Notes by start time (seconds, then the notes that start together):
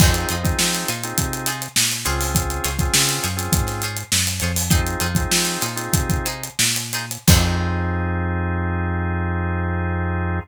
0.00 F2 C4 D#4 F4 G#4 C5, kick, crash
0.14 closed hi-hat
0.29 F2 D#4 F4 G#4 C5, closed hi-hat
0.43 C4 D#4 F4 G#4, kick, closed hi-hat
0.59 F3, snare
0.73 snare, closed hi-hat
0.88 A#2 D#4 F4 G#4 C5, closed hi-hat
1.03 C4 D#4 F4 G#4, closed hi-hat
1.18 C3, kick, closed hi-hat
1.33 closed hi-hat
1.46 D#4 F4 G#4 C5, snare, closed hi-hat
1.62 closed hi-hat
1.76 A#2, snare
1.92 closed hi-hat
2.05 C#2 C4 C#4 F4 G#4 C5 C#5, closed hi-hat
2.21 open hi-hat
2.35 kick, closed hi-hat
2.50 closed hi-hat
2.64 C#2 F4 G#4 C5 C#5, snare, closed hi-hat
2.79 C4 C#4 F4 G#4, kick, closed hi-hat
2.94 C#3, snare
3.08 snare, closed hi-hat
3.23 F#2 F4 G#4 C5 C#5, closed hi-hat
3.37 C4 C#4 F4 G#4, closed hi-hat
3.52 G#2, kick, closed hi-hat
3.67 snare, closed hi-hat
3.82 F4 G#4 C5 C#5, closed hi-hat
3.97 closed hi-hat
4.12 F#2, snare
4.27 closed hi-hat
4.40 F2 F4 G#4 C5 C#5, closed hi-hat
4.56 open hi-hat
4.70 C4 D#4 F4 G#4 C5, kick, closed hi-hat
4.86 closed hi-hat
5.00 F2 D#4 F4 G#4 C5, closed hi-hat
5.15 C4 D#4 F4 G#4, kick, closed hi-hat
5.31 F3, snare
5.45 snare, closed hi-hat
5.61 A#2 D#4 F4 G#4 C5, snare, closed hi-hat
5.76 C4 D#4 F4 G#4, closed hi-hat
5.93 C3, kick, closed hi-hat
6.10 kick, closed hi-hat
6.25 D#4 F4 G#4 C5, closed hi-hat
6.43 closed hi-hat
6.59 A#2, snare
6.76 closed hi-hat
6.93 D#4 F4 G#4 C5, snare, closed hi-hat
7.11 closed hi-hat
7.27 F2 C4 D#4 F4 G#4 C5, kick, crash